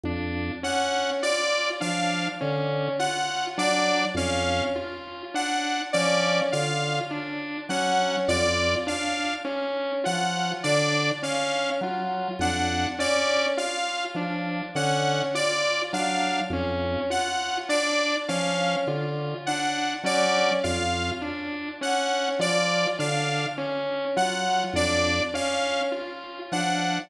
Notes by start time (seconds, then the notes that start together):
0.03 F2 D4
0.63 C#4 F#5
1.22 F4 D5
1.80 F3 D4 F5
2.41 D3 C#4
2.99 F4 F#5
3.58 F#3 D4 D5
4.14 F2 C#4 F5
4.75 F4
5.34 D4 F#5
5.93 F3 C#4 D5
6.52 D3 F4 F5
7.11 D4
7.69 F#3 C#4 F#5
8.28 F2 F4 D5
8.87 D4 F5
9.45 C#4
10.04 F3 F4 F#5
10.63 D3 D4 D5
11.23 C#4 F5
11.81 F#3 F4
12.39 F2 D4 F#5
12.99 C#4 D5
13.57 F4 F5
14.14 F3 D4
14.75 D3 C#4 F#5
15.34 F4 D5
15.93 F#3 D4 F5
16.50 F2 C#4
17.10 F4 F#5
17.69 D4 D5
18.28 F3 C#4 F5
18.87 D3 F4
19.46 D4 F#5
20.03 F#3 C#4 D5
20.63 F2 F4 F5
21.22 D4
21.81 C#4 F#5
22.39 F3 F4 D5
22.99 D3 D4 F5
23.58 C#4
24.16 F#3 F4 F#5
24.73 F2 D4 D5
25.34 C#4 F5
25.92 F4
26.52 F3 D4 F#5